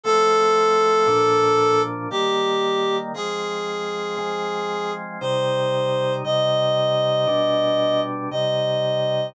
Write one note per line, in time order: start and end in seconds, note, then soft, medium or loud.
0.03 1.06 F3 medium
0.03 1.06 A3 medium
0.03 1.06 C4 medium
0.03 1.80 A4 loud
1.06 2.08 A#2 medium
1.06 2.08 F3 medium
1.06 2.08 D4 medium
2.10 3.13 D#3 medium
2.10 3.13 G3 medium
2.10 3.13 A#3 medium
2.10 2.96 G4 medium
3.14 4.17 F3 medium
3.14 4.17 G#3 medium
3.14 4.17 C4 medium
3.14 4.91 G#4 loud
4.17 5.19 F3 medium
4.17 5.19 G#3 medium
4.17 5.19 C4 medium
5.21 6.22 C3 medium
5.21 6.22 G3 medium
5.21 6.22 D#4 medium
5.21 6.13 C5 loud
6.24 7.26 C3 medium
6.24 7.26 G3 medium
6.24 7.26 D#4 medium
6.24 8.00 D#5 loud
7.27 8.28 B2 medium
7.27 8.28 G3 medium
7.27 8.28 D4 medium
8.31 9.33 C3 medium
8.31 9.33 G3 medium
8.31 9.33 D#4 medium
8.31 9.27 D#5 medium